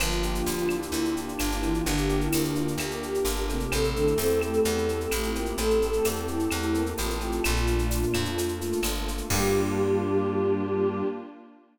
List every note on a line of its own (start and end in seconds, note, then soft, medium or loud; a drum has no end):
0.00 0.42 G1 loud
0.00 0.76 F3 medium
0.00 0.46 A#3 loud
0.00 1.84 A#3 medium
0.00 1.84 D4 medium
0.00 1.84 F4 medium
0.00 0.76 F4 medium
0.00 0.43 F4 medium
0.00 1.84 G4 medium
0.00 cowbell medium
0.00 claves loud
0.00 shaker medium
0.11 shaker medium
0.23 1.15 G4 medium
0.23 shaker medium
0.35 shaker medium
0.46 0.88 D2 medium
0.46 0.93 A#3 medium
0.46 0.68 F4 medium
0.46 tambourine medium
0.46 shaker medium
0.58 shaker medium
0.69 1.14 E4 medium
0.69 1.39 F4 medium
0.69 claves medium
0.69 shaker medium
0.82 shaker medium
0.92 1.34 D2 medium
0.92 1.61 A#3 medium
0.92 cowbell medium
0.92 shaker medium
1.05 shaker medium
1.15 1.26 D4 medium
1.15 2.09 G4 medium
1.15 shaker medium
1.27 1.38 D4 medium
1.27 shaker medium
1.39 1.82 G1 medium
1.39 1.53 D4 medium
1.39 2.56 F4 medium
1.39 tambourine medium
1.39 cowbell medium
1.39 claves medium
1.39 shaker medium
1.52 1.70 E4 medium
1.52 shaker medium
1.62 1.86 E3 medium
1.62 1.85 A#3 medium
1.62 1.86 E4 loud
1.62 cowbell medium
1.62 shaker medium
1.71 1.86 F4 medium
1.71 shaker medium
1.85 2.28 G1 loud
1.85 2.76 D3 medium
1.85 2.32 A#3 medium
1.85 3.70 A#3 medium
1.85 2.76 D4 loud
1.85 3.70 D4 medium
1.85 3.70 G4 medium
1.85 2.20 G4 medium
1.85 3.70 A#4 medium
1.85 cowbell medium
1.85 shaker medium
1.97 shaker medium
2.09 3.02 G4 medium
2.09 shaker medium
2.20 2.53 E4 medium
2.20 shaker medium
2.32 2.76 D2 medium
2.32 2.78 A#3 medium
2.32 tambourine medium
2.32 claves medium
2.32 shaker loud
2.44 shaker medium
2.54 2.73 F4 medium
2.54 3.24 F4 medium
2.54 shaker medium
2.68 shaker medium
2.78 3.19 D2 medium
2.78 3.67 A#3 medium
2.78 2.99 G4 medium
2.78 cowbell medium
2.78 claves medium
2.78 shaker medium
2.91 shaker medium
3.03 3.69 G4 medium
3.03 3.42 G4 medium
3.03 shaker medium
3.14 shaker medium
3.25 3.67 G1 medium
3.25 3.69 F4 medium
3.25 tambourine medium
3.25 cowbell medium
3.25 shaker medium
3.37 shaker medium
3.49 3.71 C3 medium
3.49 4.65 A3 medium
3.49 3.71 C4 medium
3.49 3.72 G4 medium
3.49 cowbell medium
3.49 shaker medium
3.60 shaker medium
3.72 4.14 A1 medium
3.72 3.94 C3 loud
3.72 5.56 A3 medium
3.72 3.94 C4 loud
3.72 5.56 C4 medium
3.72 5.56 E4 medium
3.72 5.56 G4 medium
3.72 4.60 A4 medium
3.72 cowbell loud
3.72 claves medium
3.72 shaker medium
3.84 shaker medium
3.95 4.14 D3 medium
3.95 4.88 C4 medium
3.95 4.14 D4 medium
3.95 shaker medium
4.07 shaker medium
4.18 4.60 E2 medium
4.18 4.39 C4 medium
4.18 5.11 E4 medium
4.18 4.39 C5 medium
4.18 tambourine medium
4.18 shaker medium
4.30 shaker medium
4.41 5.05 A3 medium
4.41 5.35 G4 medium
4.41 5.05 A4 medium
4.41 claves medium
4.41 shaker medium
4.53 shaker medium
4.65 5.07 E2 loud
4.65 5.57 A3 medium
4.65 4.96 A4 medium
4.65 cowbell medium
4.65 shaker medium
4.78 shaker medium
4.89 5.81 C4 medium
4.89 shaker medium
5.00 5.11 A4 medium
5.00 shaker medium
5.11 5.53 A1 medium
5.11 5.30 A3 medium
5.11 6.04 E4 medium
5.11 5.22 G4 medium
5.11 5.30 A4 medium
5.11 tambourine medium
5.11 cowbell medium
5.11 claves medium
5.11 shaker medium
5.21 5.43 F4 medium
5.21 shaker medium
5.35 5.56 A#3 medium
5.35 6.28 G4 medium
5.35 5.56 A#4 medium
5.35 cowbell medium
5.35 shaker medium
5.46 5.58 G4 medium
5.46 shaker medium
5.56 6.00 A1 medium
5.56 6.50 A3 medium
5.56 5.79 A3 medium
5.56 7.42 A3 medium
5.56 7.42 C4 medium
5.56 7.42 G4 medium
5.56 6.21 A4 medium
5.56 5.79 A4 loud
5.56 7.42 A4 medium
5.56 cowbell loud
5.56 shaker medium
5.70 shaker medium
5.82 6.73 C4 medium
5.82 shaker medium
5.93 shaker medium
6.05 6.48 E2 medium
6.05 6.97 E4 medium
6.05 tambourine medium
6.05 claves medium
6.05 shaker medium
6.16 shaker medium
6.27 6.92 E4 medium
6.27 7.21 G4 medium
6.27 shaker medium
6.39 shaker medium
6.51 6.94 E2 medium
6.51 7.39 A3 medium
6.51 cowbell medium
6.51 claves medium
6.51 shaker medium
6.62 shaker medium
6.74 7.14 A#3 medium
6.74 7.40 C4 medium
6.74 7.14 A#4 medium
6.74 shaker medium
6.86 shaker medium
6.97 7.40 A1 medium
6.97 7.41 E4 medium
6.97 7.43 F4 medium
6.97 tambourine medium
6.97 cowbell medium
6.97 shaker medium
7.10 shaker medium
7.20 7.44 G4 medium
7.20 cowbell medium
7.20 shaker medium
7.32 shaker medium
7.43 8.05 A#1 loud
7.43 8.26 A#2 medium
7.43 8.36 A3 medium
7.43 8.26 A#3 loud
7.43 8.36 A#3 medium
7.43 8.36 D4 medium
7.43 8.81 F4 medium
7.43 8.36 F4 medium
7.43 cowbell medium
7.43 claves loud
7.43 shaker medium
7.56 shaker medium
7.67 8.59 A#3 medium
7.67 shaker medium
7.79 shaker medium
7.90 8.84 D4 medium
7.90 tambourine medium
7.90 shaker medium
8.03 shaker medium
8.14 8.74 F2 medium
8.14 9.07 F4 medium
8.14 claves medium
8.14 shaker medium
8.25 shaker medium
8.37 9.25 A3 medium
8.37 9.29 A3 medium
8.37 9.29 A#3 medium
8.37 9.29 F4 medium
8.37 9.29 A4 medium
8.37 cowbell medium
8.37 shaker medium
8.48 shaker medium
8.60 9.26 A#3 medium
8.60 shaker medium
8.72 shaker medium
8.83 9.22 G1 medium
8.83 9.28 D4 medium
8.83 tambourine medium
8.83 cowbell medium
8.83 claves medium
8.83 shaker loud
8.95 shaker medium
9.07 9.30 F4 medium
9.07 cowbell medium
9.07 shaker medium
9.18 shaker medium
9.30 11.03 G2 loud
9.30 11.03 G3 loud
9.30 11.03 A#3 loud
9.30 11.03 D4 loud
9.30 11.03 F4 loud
9.30 11.03 G4 loud
9.30 11.03 G4 medium
9.30 kick loud
9.30 crash loud